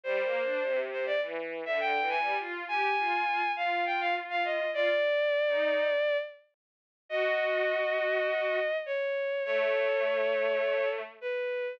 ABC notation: X:1
M:4/4
L:1/16
Q:1/4=102
K:Eb
V:1 name="Violin"
c6 c d z3 =e g2 a2 | z2 a6 f2 g f z f e2 | d12 z4 | [K:E] d12 c4 |
c12 B4 |]
V:2 name="Violin"
(3G,2 B,2 D2 C,4 =E,3 D, (3D,2 E,2 G,2 | F2 G2 F2 F z F8 | F z4 E3 z8 | [K:E] F12 z4 |
A,12 z4 |]